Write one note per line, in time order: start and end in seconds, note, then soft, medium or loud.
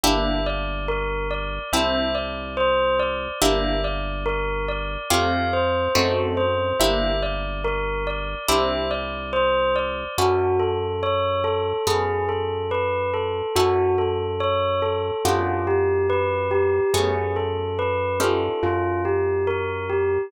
0.04 1.59 G1 medium
0.04 1.70 A#3 medium
0.04 1.70 D4 medium
0.04 1.70 E4 medium
0.04 1.70 G4 loud
0.04 0.42 E5 medium
0.46 0.85 D5 medium
0.88 1.27 A#4 medium
1.31 1.70 D5 medium
1.73 3.28 C2 medium
1.73 3.39 C4 medium
1.73 3.39 D4 medium
1.73 3.39 E4 medium
1.73 3.39 G4 medium
1.73 2.12 E5 medium
2.15 2.54 D5 soft
2.57 2.96 C5 medium
2.99 3.38 D5 medium
3.42 4.97 G1 medium
3.42 5.07 A#3 medium
3.42 5.07 D4 medium
3.42 5.07 E4 medium
3.42 5.07 G4 medium
3.42 3.80 E5 medium
3.84 4.23 D5 medium
4.26 4.65 A#4 medium
4.68 5.07 D5 medium
5.10 5.89 F2 medium
5.10 5.93 A3 medium
5.10 5.93 C4 medium
5.10 5.93 F4 medium
5.10 5.93 G4 loud
5.10 5.50 F5 medium
5.53 5.92 C5 medium
5.95 6.73 F#2 loud
5.95 6.78 A3 medium
5.95 6.78 C4 medium
5.95 6.78 D#4 medium
5.95 6.78 F#4 medium
5.95 6.34 A4 medium
6.37 6.76 C5 medium
6.80 8.35 G1 medium
6.80 8.46 A#3 medium
6.80 8.46 D4 medium
6.80 8.46 E4 medium
6.80 8.46 G4 medium
6.80 7.18 E5 medium
7.23 7.61 D5 medium
7.64 8.03 A#4 medium
8.07 8.46 D5 medium
8.48 10.04 C2 medium
8.48 10.14 C4 medium
8.48 10.14 D4 medium
8.48 10.14 E4 loud
8.48 10.14 G4 medium
8.48 8.88 E5 medium
8.91 9.30 D5 medium
9.33 9.72 C5 medium
9.76 10.15 D5 medium
10.18 11.73 F#2 medium
10.18 11.84 C#4 medium
10.18 11.84 E4 medium
10.18 10.57 F#4 medium
10.18 11.84 F#4 medium
10.18 11.84 A4 medium
10.60 10.98 A4 medium
11.03 11.42 C#5 medium
11.44 11.83 A4 medium
11.87 13.42 F#2 medium
11.87 13.53 B3 medium
11.87 13.53 C#4 medium
11.87 13.53 G#4 medium
11.87 12.26 G#4 medium
11.87 13.53 A4 medium
12.29 12.68 A4 medium
12.71 13.10 B4 medium
13.14 13.52 A4 medium
13.56 15.11 F#2 medium
13.56 15.22 C#4 medium
13.56 15.22 E4 medium
13.56 13.95 F#4 medium
13.56 15.22 F#4 medium
13.56 15.22 A4 medium
13.98 14.37 A4 medium
14.40 14.79 C#5 medium
14.82 15.21 A4 medium
15.25 16.80 F#2 loud
15.25 16.91 B3 medium
15.25 16.91 D4 medium
15.25 15.64 F4 medium
15.25 16.91 F4 medium
15.25 16.91 G4 medium
15.67 16.06 G4 medium
16.10 16.49 B4 medium
16.51 16.90 G4 medium
16.94 18.49 F#2 loud
16.94 18.14 A3 medium
16.94 18.14 B3 medium
16.94 18.14 C#4 medium
16.94 17.33 G#4 medium
16.94 18.14 G#4 medium
17.36 17.75 A4 medium
17.79 18.18 B4 medium
18.20 20.28 C#4 medium
18.20 20.28 D#4 medium
18.20 20.28 F4 medium
18.20 20.28 G4 medium
18.20 18.60 A4 medium
18.63 20.18 F#2 medium
18.63 19.02 F4 medium
19.05 19.44 G4 medium
19.47 19.86 A#4 medium
19.90 20.28 G4 medium